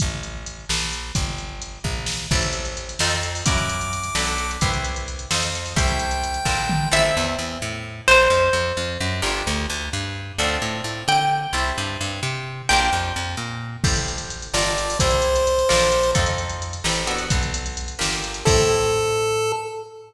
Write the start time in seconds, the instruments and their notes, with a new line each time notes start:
0.00 electric bass (finger) A1, kick, closed hi-hat
0.23 closed hi-hat
0.46 closed hi-hat
0.69 electric bass (finger) A#1, snare
0.93 closed hi-hat
1.15 electric bass (finger) G1, kick, closed hi-hat
1.38 closed hi-hat
1.62 closed hi-hat
1.84 electric bass (finger) A#1, kick
2.06 snare
2.31 electric bass (finger) A1, pizzicato strings C4 E4 G4 A4, kick, crash
2.42 closed hi-hat
2.53 closed hi-hat
2.65 closed hi-hat
2.77 closed hi-hat
2.89 closed hi-hat
2.99 electric bass (finger) F2, pizzicato strings C4 D#4 F4 A4, snare
3.10 closed hi-hat
3.23 closed hi-hat
3.35 open hi-hat
3.46 electric bass (finger) F#2, pizzicato strings C#4 E4 F#4 A#4, lead 1 (square) D6, kick, closed hi-hat
3.58 closed hi-hat
3.69 closed hi-hat
3.81 closed hi-hat
3.93 closed hi-hat
4.04 closed hi-hat
4.15 electric bass (finger) B1, pizzicato strings D4 F#4 A4 B4, snare
4.27 closed hi-hat
4.38 closed hi-hat
4.51 closed hi-hat
4.61 electric bass (finger) C2, pizzicato strings E4 G4 B4 C5, kick, closed hi-hat
4.74 closed hi-hat
4.84 closed hi-hat
4.96 closed hi-hat
5.08 closed hi-hat
5.19 closed hi-hat
5.31 electric bass (finger) F2, pizzicato strings D#4 F4 A4 C5, snare
5.43 closed hi-hat
5.55 closed hi-hat
5.66 open hi-hat
5.76 electric bass (finger) C2, pizzicato strings E4 G4 A4 C5, lead 1 (square) G5, kick, closed hi-hat
5.88 closed hi-hat
5.99 closed hi-hat
6.11 closed hi-hat
6.24 closed hi-hat
6.34 closed hi-hat
6.45 electric bass (finger) A#1, pizzicato strings D4 F4 A4 A#4, kick, snare
6.69 mid tom
6.92 electric bass (finger) A1, pizzicato strings C4 E4 G4 A4 E5
7.17 electric bass (finger) E2
7.39 electric bass (finger) E2
7.62 electric bass (finger) A2
8.08 electric bass (finger) A#1, pizzicato strings C5
8.30 electric bass (finger) F2
8.53 electric bass (finger) F2
8.77 electric bass (finger) F2
9.00 electric bass (finger) F#2
9.22 electric bass (finger) G1, pizzicato strings D4 F4 G4 A#4
9.47 electric bass (finger) D2
9.70 electric bass (finger) D2
9.93 electric bass (finger) G2
10.38 electric bass (finger) D2, pizzicato strings C4 D4 F4 A4
10.62 electric bass (finger) A2
10.84 electric bass (finger) A2
11.08 electric bass (finger) D3, pizzicato strings G5
11.53 electric bass (finger) C2, pizzicato strings C4 E4 G4 A4
11.78 electric bass (finger) G2
12.01 electric bass (finger) G2
12.23 electric bass (finger) C3
12.69 electric bass (finger) A#1, pizzicato strings D4 F4 G4 A#4 G5
12.92 electric bass (finger) F2
13.16 electric bass (finger) F2
13.37 electric bass (finger) A#2
13.84 electric bass (finger) A1, pizzicato strings E4 G4 A4 C5, kick, crash
13.96 closed hi-hat
14.08 closed hi-hat
14.18 closed hi-hat
14.30 closed hi-hat
14.42 closed hi-hat
14.54 electric bass (finger) G1, pizzicato strings D4 F4 G4 A#4, lead 1 (square) D5, snare
14.66 closed hi-hat
14.78 closed hi-hat
14.90 open hi-hat
15.00 electric bass (finger) C2, pizzicato strings C4 E4 G4 A4, lead 1 (square) C5, kick, closed hi-hat
15.11 closed hi-hat
15.22 closed hi-hat
15.36 closed hi-hat
15.47 closed hi-hat
15.59 closed hi-hat
15.69 electric bass (finger) A#1, pizzicato strings D4 F4 A4 A#4, snare
15.81 closed hi-hat
15.92 closed hi-hat
16.03 closed hi-hat
16.15 electric bass (finger) F2, pizzicato strings C4 D#4 F4 A4, kick, closed hi-hat
16.26 closed hi-hat
16.38 closed hi-hat
16.49 closed hi-hat
16.62 closed hi-hat
16.73 closed hi-hat
16.84 electric bass (finger) A1, pizzicato strings C4 E4 G4 A4, snare
16.95 closed hi-hat
17.07 pizzicato strings B3 D4 F#4 A4, closed hi-hat
17.18 closed hi-hat
17.30 electric bass (finger) B1, kick, closed hi-hat
17.43 closed hi-hat
17.54 closed hi-hat
17.66 closed hi-hat
17.77 closed hi-hat
17.88 closed hi-hat
17.99 electric bass (finger) G1, pizzicato strings A#3 D4 F4 G4, snare
18.12 closed hi-hat
18.24 closed hi-hat
18.34 closed hi-hat
18.45 electric bass (finger) A2, pizzicato strings C4 E4 G4 A4, lead 1 (square) A4, kick, crash